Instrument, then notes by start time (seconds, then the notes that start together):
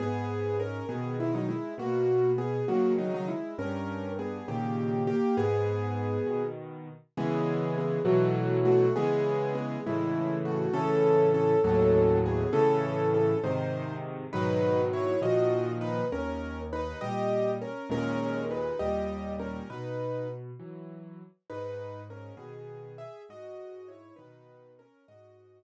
acoustic grand piano
0.00 G#2 B3 G#4
0.60 C#4 A#4
0.89 B2 D#3 B3 G#4
1.20 G#3 E4
1.35 F#3 D#4
1.49 G#3 E4
1.78 B2 A#3 F#4
2.38 B3 G#4
2.68 C#3 D#3 F#3 A#3 F#4
2.98 F#3 D#4
3.14 F#3 D#4
3.28 G#3 E4
3.58 G2 C#4 A#4
4.19 B3 G#4
4.48 A#2 C#3 D#3 A#3 G4
5.07 A#3 G4
5.37 G#2 B3 G#4
6.26 B2 D#3
7.17 C#3 E3 G#3 B3 G#4
7.78 B3 G#4
8.05 B2 E3 F#3 A3 F#4
8.65 A3 F#4
8.96 C#3 E3 G#3 B3 G#4
9.55 B3 G#4
9.86 A2 C#3 E3 G#3 E4
10.45 A3 F#4
10.73 A2 C#3 E3 C#4 A4
11.34 C#4 A4
11.64 D#2 A2 F#3 C#4 A4
12.26 B3 G#4
12.53 A2 C#3 E3 C#4 A4
13.14 C#4 A4
13.44 G#2 C3 D#3 D#4 C5
14.33 G#2 B2 D#3 F#3 D#4 B4
14.93 E4 C#5
15.22 A#2 D#3 F3 F#4 D#5
15.81 D#4 B4
16.12 D#2 C#4 A#4
16.73 D#4 B4
17.01 A#2 G3 G4 D#5
17.61 C#4 A#4
17.90 D#2 A#2 G#3 C#4 A#4
18.51 D#4 B4
18.79 D#2 A#2 G3 G4 D#5
19.39 C#4 A#4
19.70 B2 D#4 B4
20.59 E3 F#3
21.50 G#2 D#4 B4
22.10 C#4 A#4
22.37 B2 D#3 B3 G#4
22.98 G#4 E5
23.29 G#2 F#4 D#5
23.88 E4 C#5
24.16 B2 D#3 D#4 B4
24.79 C#4 A#4
25.08 G#2 F#4 D#5